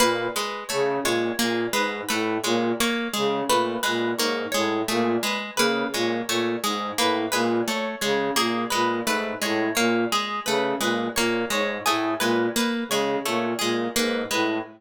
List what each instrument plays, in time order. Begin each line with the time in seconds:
0.00 flute A#2, orchestral harp A#3 B4
0.36 orchestral harp G#3 B4
0.69 flute C#3, orchestral harp A3 C#5
1.03 flute A#2, orchestral harp G#3 C#5
1.39 flute A#2, orchestral harp A#3 G#4
1.73 flute G#2, orchestral harp G#3 B4
2.09 flute A2, orchestral harp A3 B4
2.44 flute A#2, orchestral harp G#3 C#5
2.80 orchestral harp A#3 C#5
3.14 flute C#3, orchestral harp G#3 G#4
3.49 flute A#2, orchestral harp A3 B4
3.83 flute A#2, orchestral harp G#3 B4
4.17 flute G#2, orchestral harp A#3 C#5
4.52 flute A2, orchestral harp G#3 C#5
4.88 flute A#2, orchestral harp A3 G#4
5.23 orchestral harp G#3 B4
5.56 flute C#3, orchestral harp A#3 B4
5.93 flute A#2, orchestral harp G#3 C#5
6.28 flute A#2, orchestral harp A3 C#5
6.64 flute G#2, orchestral harp G#3 G#4
6.98 flute A2, orchestral harp A#3 B4
7.32 flute A#2, orchestral harp G#3 B4
7.68 orchestral harp A3 C#5
8.01 flute C#3, orchestral harp G#3 C#5
8.36 flute A#2, orchestral harp A#3 G#4
8.70 flute A#2, orchestral harp G#3 B4
9.05 flute G#2, orchestral harp A3 B4
9.42 flute A2, orchestral harp G#3 C#5
9.75 flute A#2, orchestral harp A#3 C#5
10.12 orchestral harp G#3 G#4
10.46 flute C#3, orchestral harp A3 B4
10.80 flute A#2, orchestral harp G#3 B4
11.16 flute A#2, orchestral harp A#3 C#5
11.50 flute G#2, orchestral harp G#3 C#5
11.86 flute A2, orchestral harp A3 G#4
12.20 flute A#2, orchestral harp G#3 B4
12.56 orchestral harp A#3 B4
12.89 flute C#3, orchestral harp G#3 C#5
13.25 flute A#2, orchestral harp A3 C#5
13.59 flute A#2, orchestral harp G#3 G#4
13.96 flute G#2, orchestral harp A#3 B4
14.31 flute A2, orchestral harp G#3 B4